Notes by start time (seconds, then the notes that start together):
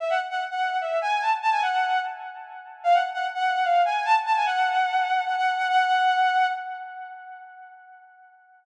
0.00 E5
0.10 F#5
0.31 F#5
0.51 F#5
0.81 E5
1.02 G#5
1.22 A5
1.42 A5
1.52 G#5
1.62 F#5
2.84 F5
2.94 F#5
3.14 F#5
3.34 F#5
3.65 F5
3.85 G#5
4.05 A5
4.26 A5
4.36 G#5
4.46 F#5
5.27 F#5
5.37 F#5
5.58 F#5
5.68 F#5